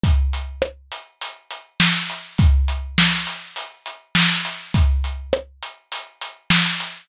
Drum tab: HH |xx-xxx-x|xx-xxx-x|xx-xxx-x|
SD |--r---o-|--o---o-|--r---o-|
BD |o-------|o-------|o-------|